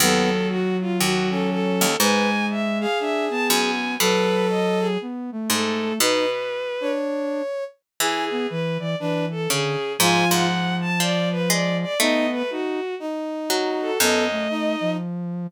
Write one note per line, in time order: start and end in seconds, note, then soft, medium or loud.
0.00 0.96 D#2 medium
0.00 1.86 F#3 loud
0.00 0.30 B3 medium
0.00 0.47 A4 medium
0.49 0.77 F#4 medium
0.81 0.99 F4 medium
1.00 1.76 D#2 medium
1.00 1.29 F#4 medium
1.30 1.93 C#4 medium
1.30 1.49 A4 medium
1.50 1.95 A4 medium
1.81 1.97 D#2 medium
1.99 3.41 G#2 medium
1.99 2.86 G#3 loud
1.99 2.29 B4 medium
1.99 2.46 G#5 medium
2.50 2.78 E5 medium
2.80 3.71 G#4 medium
2.80 2.98 F5 medium
3.00 3.29 D4 medium
3.00 3.25 E5 medium
3.30 3.96 B3 medium
3.30 3.47 A5 medium
3.49 3.98 F#2 medium
3.49 3.94 G#5 medium
3.99 5.40 B2 medium
3.99 4.97 F#3 loud
3.99 4.87 A4 loud
3.99 4.47 B4 medium
4.49 4.79 D#5 medium
4.80 4.98 G#4 medium
5.01 5.31 B3 medium
5.32 5.99 A3 medium
5.50 5.93 G#2 medium
5.50 5.94 A4 medium
5.99 6.89 B2 medium
5.99 6.26 D#4 loud
5.99 6.30 B4 medium
5.99 6.91 B4 medium
6.81 7.42 D4 medium
6.81 7.64 C#5 medium
8.00 9.31 E3 medium
8.00 8.29 E4 medium
8.00 8.25 G#4 medium
8.00 8.47 G#4 medium
8.31 8.47 B3 medium
8.49 8.78 E3 loud
8.49 8.77 B4 medium
8.79 8.95 E3 loud
8.79 8.96 D5 medium
9.00 9.47 E3 medium
9.00 9.25 D4 medium
9.00 9.25 B4 medium
9.31 9.49 A4 medium
9.50 9.97 C#3 medium
9.50 9.76 D3 medium
9.50 9.93 G#4 medium
9.99 10.25 G#2 loud
9.99 11.85 F3 loud
9.99 10.47 F4 medium
9.99 10.27 G#5 loud
10.31 10.90 G#2 medium
10.31 10.76 F#5 medium
10.81 10.99 A5 medium
11.00 11.49 F3 medium
11.00 11.29 D5 medium
11.31 11.49 B4 medium
11.50 11.95 G#3 medium
11.50 11.77 D5 medium
11.82 11.98 D5 medium
11.99 13.26 A3 loud
11.99 12.43 B3 loud
11.99 12.26 D#4 medium
11.99 12.30 D#5 medium
12.32 12.50 B4 medium
12.50 12.80 D#4 medium
12.50 12.95 F#4 medium
13.00 13.90 D#4 medium
13.50 13.98 F#3 medium
13.50 13.98 F#4 medium
13.81 13.99 A4 medium
14.00 14.48 F#2 medium
14.00 14.28 B3 loud
14.00 14.24 A4 medium
14.00 14.90 D#5 medium
14.31 14.76 A3 medium
14.50 14.97 D#4 medium
14.81 15.47 F3 medium